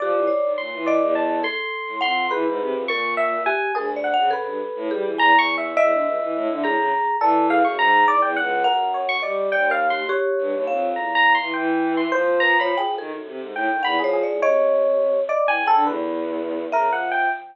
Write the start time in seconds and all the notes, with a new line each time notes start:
0.00 F3 G4 D5
0.14 E3
0.27 C#5
0.43 D#3
0.58 A#2 C6
0.73 E3
0.86 D5 D#5
1.01 E2
1.15 A5
1.43 A4 C6
1.87 A2
2.01 F2 F#5 C6
2.31 E3 G#4 B4
2.47 G#2
2.60 C3
2.73 F2
2.88 A#2 A#4 C#6
3.17 E5
3.46 G4 G#5
3.75 D2 G#4 A#4
3.96 D5
4.04 F#5
4.14 C#3 F#5
4.31 C#3 A4 B4
4.45 G2
4.75 A2
4.91 G3 G#4
5.03 E3
5.18 E2 G#5 A#5
5.33 E2
5.39 C#6
5.58 E5
5.77 E2 D#5 E5
5.91 D3
6.05 C#2
6.21 E3
6.35 A2
6.50 D3
6.62 A2 G#4 A#5
6.77 C#3
7.20 E3 A4 D5
7.50 G#4 F5
7.65 F#2 C#6
7.78 G#2 A#5
8.07 E2 D5
8.22 E2 G5
8.37 C#2 F#5
8.64 F#2 A#4 F#5
8.94 C#5
9.09 C#6
9.22 G3 D5 D#5
9.52 D#2 D5 G5
9.70 A#4 F5
9.90 G4 C6
10.09 G4 C#5
10.39 G2
10.53 D#2
10.67 F2 F5
10.95 E2 A#5
11.15 A#5
11.35 C6
11.40 E3
11.54 E3 G5
11.97 C6
12.11 F3 C5
12.40 B4 A#5
12.60 C#5 B5
12.78 G#4 G5
12.84 F3
12.98 D#3 A4
13.11 F#2
13.26 C3
13.40 G#2
13.54 A2 G5
13.71 D#3
13.83 E2 F#5 B5
13.98 F3 G#4
14.04 C#5
14.13 G#4
14.23 D5
14.28 A2
14.40 C3 C#5 D#5
15.29 D5 D#5
15.45 E3 G5 G#5
15.58 C#3
15.66 A4 G5
15.74 D3
15.85 E2 B4
16.72 C#3 A#4 E5
16.86 F3
16.93 F#5
17.12 G5